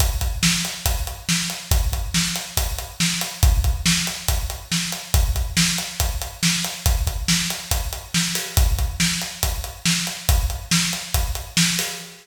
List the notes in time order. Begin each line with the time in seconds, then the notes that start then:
0.00 kick, closed hi-hat
0.21 kick, closed hi-hat
0.43 snare
0.65 closed hi-hat
0.86 kick, closed hi-hat
1.07 closed hi-hat
1.29 snare
1.50 closed hi-hat
1.71 kick, closed hi-hat
1.92 kick, closed hi-hat
2.14 snare
2.36 closed hi-hat
2.57 kick, closed hi-hat
2.78 closed hi-hat
3.00 snare
3.21 closed hi-hat
3.43 kick, closed hi-hat
3.64 kick, closed hi-hat
3.86 snare
4.07 closed hi-hat
4.28 kick, closed hi-hat
4.50 closed hi-hat
4.72 snare
4.92 closed hi-hat
5.14 kick, closed hi-hat
5.36 kick, closed hi-hat
5.57 snare
5.78 closed hi-hat
6.00 kick, closed hi-hat
6.22 closed hi-hat
6.43 snare
6.64 closed hi-hat
6.86 kick, closed hi-hat
7.07 kick, closed hi-hat
7.28 snare
7.50 closed hi-hat
7.71 kick, closed hi-hat
7.93 closed hi-hat
8.14 snare
8.35 open hi-hat
8.57 kick, closed hi-hat
8.79 kick, closed hi-hat
9.00 snare
9.22 closed hi-hat
9.43 kick, closed hi-hat
9.64 closed hi-hat
9.86 snare
10.07 closed hi-hat
10.29 kick, closed hi-hat
10.50 closed hi-hat
10.71 snare
10.93 closed hi-hat
11.14 kick, closed hi-hat
11.35 closed hi-hat
11.57 snare
11.79 open hi-hat